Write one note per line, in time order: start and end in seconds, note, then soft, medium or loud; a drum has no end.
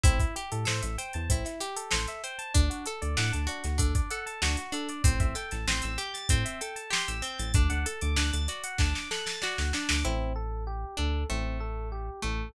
0.03 0.19 A1 loud
0.03 0.18 C4 loud
0.03 0.35 E4 loud
0.03 kick loud
0.03 closed hi-hat loud
0.20 0.34 E4 medium
0.20 kick loud
0.20 closed hi-hat medium
0.36 0.50 G4 medium
0.36 0.68 G4 medium
0.36 closed hi-hat medium
0.52 0.66 A2 medium
0.52 0.66 A4 medium
0.52 closed hi-hat medium
0.65 0.82 A2 medium
0.65 0.96 A4 medium
0.65 0.81 C5 medium
0.65 snare loud
0.82 0.97 A1 medium
0.82 0.96 E5 medium
0.82 closed hi-hat loud
0.98 1.30 C5 medium
0.98 1.12 G5 medium
0.98 closed hi-hat loud
1.13 1.29 E2 medium
1.13 1.28 A5 medium
1.13 closed hi-hat medium
1.29 1.44 A1 medium
1.29 1.43 C4 medium
1.29 1.62 E4 medium
1.29 kick loud
1.29 closed hi-hat loud
1.45 1.59 E4 medium
1.45 snare soft
1.45 closed hi-hat medium
1.60 1.92 G4 medium
1.60 1.75 G4 medium
1.60 snare soft
1.60 closed hi-hat loud
1.76 1.90 A4 medium
1.76 closed hi-hat loud
1.91 2.07 A1 medium
1.91 2.22 A4 medium
1.91 2.06 C5 medium
1.91 snare loud
2.07 2.22 E5 medium
2.07 closed hi-hat medium
2.24 2.53 C5 medium
2.24 2.38 G5 medium
2.24 closed hi-hat medium
2.39 2.53 A5 medium
2.39 closed hi-hat medium
2.54 2.69 D2 loud
2.54 2.68 D4 loud
2.54 2.86 D4 loud
2.54 kick loud
2.54 closed hi-hat loud
2.70 2.84 F#4 medium
2.70 closed hi-hat medium
2.86 3.00 A4 medium
2.86 3.18 A4 medium
2.86 closed hi-hat loud
3.02 3.16 D2 medium
3.02 3.16 D5 medium
3.02 closed hi-hat medium
3.17 3.32 A2 medium
3.17 3.48 D4 medium
3.17 3.31 F#5 medium
3.17 snare loud
3.32 3.48 D2 medium
3.32 3.46 A5 medium
3.32 closed hi-hat medium
3.47 3.62 D4 medium
3.47 3.78 F#4 medium
3.47 closed hi-hat medium
3.64 3.79 D2 medium
3.64 3.78 F#4 medium
3.64 snare medium
3.64 closed hi-hat medium
3.78 3.94 D2 medium
3.78 4.09 D4 medium
3.78 3.93 A4 medium
3.78 kick loud
3.78 closed hi-hat loud
3.95 4.09 D5 medium
3.95 kick loud
3.95 closed hi-hat loud
4.10 4.42 A4 medium
4.10 4.24 F#5 medium
4.10 closed hi-hat medium
4.26 4.40 A5 medium
4.26 closed hi-hat medium
4.42 4.56 D2 medium
4.42 4.56 D4 medium
4.42 4.74 F#4 medium
4.42 snare loud
4.57 4.72 F#4 medium
4.57 closed hi-hat medium
4.72 5.02 D4 medium
4.72 4.88 A4 medium
4.72 closed hi-hat medium
4.89 5.03 D5 medium
4.89 closed hi-hat medium
5.04 5.19 A1 loud
5.04 5.35 C4 loud
5.04 5.18 C5 loud
5.04 kick loud
5.04 closed hi-hat loud
5.20 5.35 A1 medium
5.20 5.34 E5 medium
5.20 kick loud
5.20 closed hi-hat medium
5.35 5.66 A4 medium
5.35 5.50 G5 medium
5.35 snare soft
5.35 closed hi-hat medium
5.51 5.66 A1 medium
5.51 5.66 A5 medium
5.51 snare medium
5.51 closed hi-hat medium
5.67 5.81 A1 medium
5.67 5.99 C4 medium
5.67 5.82 C6 medium
5.67 snare loud
5.82 5.98 A1 medium
5.82 5.97 E6 medium
5.82 closed hi-hat medium
5.98 6.29 G4 medium
5.98 6.12 G6 medium
5.98 closed hi-hat medium
6.14 6.28 A6 medium
6.14 snare medium
6.14 closed hi-hat medium
6.29 6.44 A2 medium
6.29 6.61 C4 loud
6.29 6.44 C5 medium
6.29 kick loud
6.29 closed hi-hat loud
6.45 6.59 E5 medium
6.45 closed hi-hat loud
6.61 6.93 A4 medium
6.61 6.75 G5 medium
6.61 closed hi-hat loud
6.76 6.90 A5 medium
6.76 closed hi-hat medium
6.90 7.22 G4 loud
6.90 7.06 C6 medium
6.90 snare loud
7.08 7.22 A1 medium
7.08 7.22 E6 medium
7.08 closed hi-hat medium
7.22 7.52 C4 medium
7.22 7.38 G6 medium
7.22 closed hi-hat medium
7.38 7.53 A1 medium
7.38 7.53 A6 medium
7.38 snare soft
7.38 closed hi-hat loud
7.54 7.69 D2 loud
7.54 7.86 D4 loud
7.54 7.69 D5 loud
7.54 kick loud
7.54 closed hi-hat loud
7.70 7.85 D2 medium
7.70 7.84 F#5 medium
7.70 closed hi-hat medium
7.86 8.17 A4 medium
7.86 8.00 A5 medium
7.86 closed hi-hat loud
8.01 8.16 D2 loud
8.01 8.16 D6 medium
8.01 closed hi-hat medium
8.16 8.31 D2 medium
8.16 8.48 D4 medium
8.16 8.31 F#6 medium
8.16 snare loud
8.33 8.48 D2 medium
8.33 8.47 A6 medium
8.33 closed hi-hat loud
8.48 8.80 F#4 medium
8.48 8.62 D5 medium
8.48 snare soft
8.48 closed hi-hat loud
8.64 8.78 F#5 medium
8.64 closed hi-hat loud
8.78 8.94 D2 medium
8.78 9.10 D4 medium
8.78 8.93 A5 medium
8.78 kick loud
8.78 snare loud
8.94 9.08 D6 medium
8.94 snare loud
9.11 9.42 A4 medium
9.11 9.25 F#6 medium
9.11 snare loud
9.26 9.40 A6 medium
9.26 snare loud
9.42 9.75 F#4 medium
9.42 9.56 D5 medium
9.42 snare loud
9.57 9.73 D2 medium
9.57 9.71 F#5 medium
9.57 snare loud
9.73 10.04 D4 medium
9.73 9.88 A5 medium
9.73 snare loud
9.89 10.04 D2 medium
9.89 10.03 D6 medium
9.89 snare loud
10.05 10.85 A1 loud
10.05 10.33 C4 loud
10.05 10.33 E4 loud
10.36 10.64 A4 medium
10.67 10.95 G4 medium
10.97 11.25 D2 medium
10.97 11.24 D4 medium
10.97 11.26 A4 medium
11.29 12.10 A1 loud
11.29 12.09 A3 medium
11.29 11.57 C4 medium
11.60 11.88 A4 medium
11.92 12.20 G4 medium
12.22 12.51 A1 medium
12.22 12.49 A3 medium
12.22 12.51 A4 medium